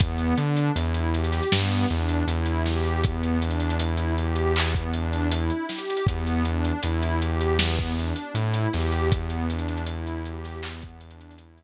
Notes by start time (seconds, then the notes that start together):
0.00 E2 B3, kick, closed hi-hat
0.18 closed hi-hat
0.38 D3 D4, closed hi-hat
0.57 closed hi-hat
0.75 E2 E4, closed hi-hat
0.94 closed hi-hat
1.14 G4, closed hi-hat
1.24 closed hi-hat
1.32 snare, closed hi-hat
1.43 closed hi-hat
1.52 G2 B3, snare
1.72 closed hi-hat
1.90 E2 D4, closed hi-hat
2.09 closed hi-hat
2.27 E2 E4, closed hi-hat
2.46 closed hi-hat
2.66 G4, snare, closed hi-hat
2.83 closed hi-hat
3.03 B3, kick, closed hi-hat
3.23 closed hi-hat
3.42 D4, closed hi-hat
3.51 closed hi-hat
3.60 closed hi-hat
3.70 closed hi-hat
3.79 E4, closed hi-hat
3.97 closed hi-hat
4.18 G4, closed hi-hat
4.36 closed hi-hat
4.56 B3, clap
4.75 kick, closed hi-hat
4.93 D4, closed hi-hat
5.13 closed hi-hat
5.31 E4, closed hi-hat
5.50 closed hi-hat
5.69 G4, snare, closed hi-hat
5.78 closed hi-hat
5.90 closed hi-hat
5.97 closed hi-hat
6.07 E2 B3, kick, closed hi-hat
6.27 closed hi-hat
6.45 D4, closed hi-hat
6.65 closed hi-hat
6.82 E2 E4, closed hi-hat
7.03 closed hi-hat
7.21 G4, closed hi-hat
7.41 closed hi-hat
7.59 B3, snare
7.78 kick, closed hi-hat
7.98 D4, closed hi-hat
8.16 closed hi-hat
8.34 A2 E4, closed hi-hat
8.54 closed hi-hat
8.73 E2 G4, snare, closed hi-hat
8.92 closed hi-hat
9.12 B3, kick, closed hi-hat
9.30 closed hi-hat
9.49 D4, closed hi-hat
9.59 closed hi-hat
9.68 closed hi-hat
9.77 closed hi-hat
9.86 E4, closed hi-hat
10.07 closed hi-hat
10.25 G4, closed hi-hat
10.44 snare, closed hi-hat
10.63 B3, clap
10.82 kick, closed hi-hat
11.01 D4, closed hi-hat
11.11 closed hi-hat
11.21 closed hi-hat
11.31 closed hi-hat
11.38 E4, closed hi-hat
11.58 closed hi-hat